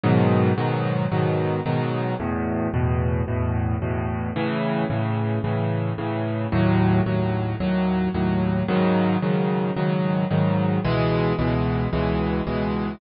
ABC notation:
X:1
M:4/4
L:1/8
Q:1/4=111
K:C#m
V:1 name="Acoustic Grand Piano" clef=bass
[G,,B,,D,F,]2 [G,,B,,D,F,]2 [G,,B,,D,F,]2 [G,,B,,D,F,]2 | [E,,A,,B,,]2 [E,,A,,B,,]2 [E,,A,,B,,]2 [E,,A,,B,,]2 | [A,,C,E,]2 [A,,C,E,]2 [A,,C,E,]2 [A,,C,E,]2 | [D,,A,,F,]2 [D,,A,,F,]2 [D,,A,,F,]2 [D,,A,,F,]2 |
[G,,C,D,F,]2 [G,,C,D,F,]2 [G,,C,D,F,]2 [G,,C,D,F,]2 | [C,,B,,E,G,]2 [C,,B,,E,G,]2 [C,,B,,E,G,]2 [C,,B,,E,G,]2 |]